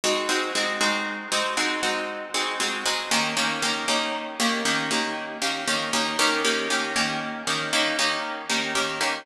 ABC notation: X:1
M:12/8
L:1/8
Q:3/8=78
K:Eb
V:1 name="Acoustic Guitar (steel)"
[A,CE_G] [A,CEG] [A,CEG] [A,CEG]2 [A,CEG] [A,CEG] [A,CEG]2 [A,CEG] [A,CEG] [A,CEG] | [E,B,_DG] [E,B,DG] [E,B,DG] [E,B,DG]2 [E,B,DG] [E,B,DG] [E,B,DG]2 [E,B,DG] [E,B,DG] [E,B,DG] | [E,B,_DG] [E,B,DG] [E,B,DG] [E,B,DG]2 [E,B,DG] [E,B,DG] [E,B,DG]2 [E,B,DG] [E,B,DG] [E,B,DG] |]